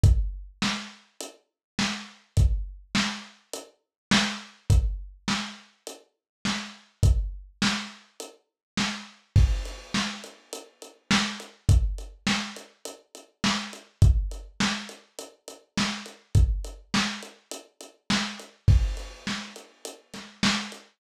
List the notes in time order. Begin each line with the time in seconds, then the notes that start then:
0.04 kick, closed hi-hat
0.62 snare
1.21 closed hi-hat
1.79 snare
2.37 kick, closed hi-hat
2.95 snare
3.53 closed hi-hat
4.11 snare
4.70 kick, closed hi-hat
5.28 snare
5.87 closed hi-hat
6.45 snare
7.03 kick, closed hi-hat
7.62 snare
8.20 closed hi-hat
8.77 snare
9.36 kick, crash
9.65 closed hi-hat
9.94 snare
10.24 closed hi-hat
10.53 closed hi-hat
10.82 closed hi-hat
11.11 snare
11.40 closed hi-hat
11.69 kick, closed hi-hat
11.98 closed hi-hat
12.27 snare
12.56 closed hi-hat
12.85 closed hi-hat
13.15 closed hi-hat
13.44 snare
13.73 closed hi-hat
14.02 kick, closed hi-hat
14.31 closed hi-hat
14.60 snare
14.89 closed hi-hat
15.19 closed hi-hat
15.48 closed hi-hat
15.77 snare
16.06 closed hi-hat
16.35 kick, closed hi-hat
16.64 closed hi-hat
16.94 snare
17.23 closed hi-hat
17.51 closed hi-hat
17.81 closed hi-hat
18.10 snare
18.39 closed hi-hat
18.68 kick, crash
18.97 closed hi-hat
19.27 snare
19.56 closed hi-hat
19.85 closed hi-hat
20.14 snare, closed hi-hat
20.43 snare
20.72 closed hi-hat